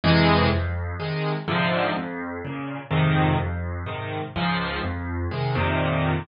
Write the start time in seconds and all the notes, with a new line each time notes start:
0.04 F2 C3 E3 G#3
0.51 F2
1.00 C3 D#3 G#3
1.48 G#2 C3 D3 F3
1.96 F2
2.45 A#2 C#3
2.91 F2 G#2 C3 D#3
3.40 F2
3.86 G#2 C3 D#3
4.36 C#2 G#2 F3
4.83 F2
5.31 C3 D#3 G#3
5.55 F2 A#2 C3 D#3